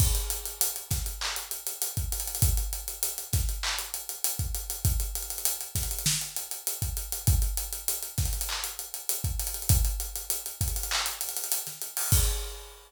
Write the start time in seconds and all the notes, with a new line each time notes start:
0.00 kick, crash
0.15 closed hi-hat
0.30 closed hi-hat
0.45 closed hi-hat
0.61 closed hi-hat
0.76 closed hi-hat
0.91 kick, snare, closed hi-hat
1.06 closed hi-hat
1.21 clap
1.36 closed hi-hat
1.51 closed hi-hat
1.67 closed hi-hat
1.82 closed hi-hat
1.97 kick, closed hi-hat
2.12 closed hi-hat
2.20 closed hi-hat
2.28 closed hi-hat
2.35 closed hi-hat
2.42 kick, closed hi-hat
2.57 closed hi-hat
2.73 closed hi-hat
2.88 closed hi-hat
3.03 closed hi-hat
3.18 closed hi-hat
3.33 kick, snare, closed hi-hat
3.49 closed hi-hat
3.63 clap
3.79 closed hi-hat
3.94 closed hi-hat
4.09 closed hi-hat
4.24 closed hi-hat
4.39 kick, closed hi-hat
4.55 closed hi-hat
4.70 closed hi-hat
4.85 kick, closed hi-hat
5.00 closed hi-hat
5.15 closed hi-hat
5.22 closed hi-hat
5.30 closed hi-hat
5.38 closed hi-hat
5.45 closed hi-hat
5.61 closed hi-hat
5.75 kick, snare, closed hi-hat
5.83 closed hi-hat
5.91 closed hi-hat
5.99 closed hi-hat
6.06 snare
6.21 closed hi-hat
6.36 closed hi-hat
6.51 closed hi-hat
6.67 closed hi-hat
6.82 kick, closed hi-hat
6.97 closed hi-hat
7.12 closed hi-hat
7.27 kick, closed hi-hat
7.42 closed hi-hat
7.57 closed hi-hat
7.73 closed hi-hat
7.88 closed hi-hat
8.03 closed hi-hat
8.18 kick, snare, closed hi-hat
8.26 closed hi-hat
8.33 closed hi-hat
8.41 closed hi-hat
8.49 clap
8.64 closed hi-hat
8.79 closed hi-hat
8.94 closed hi-hat
9.09 closed hi-hat
9.24 kick, closed hi-hat
9.40 closed hi-hat
9.47 closed hi-hat
9.54 closed hi-hat
9.62 closed hi-hat
9.69 kick, closed hi-hat
9.85 closed hi-hat
10.00 closed hi-hat
10.16 closed hi-hat
10.30 closed hi-hat
10.46 closed hi-hat
10.61 kick, closed hi-hat
10.68 closed hi-hat
10.76 closed hi-hat
10.83 closed hi-hat
10.91 clap
11.06 closed hi-hat
11.21 closed hi-hat
11.29 closed hi-hat
11.36 closed hi-hat
11.44 closed hi-hat
11.52 closed hi-hat
11.67 snare, closed hi-hat
11.82 closed hi-hat
11.97 open hi-hat
12.12 kick, crash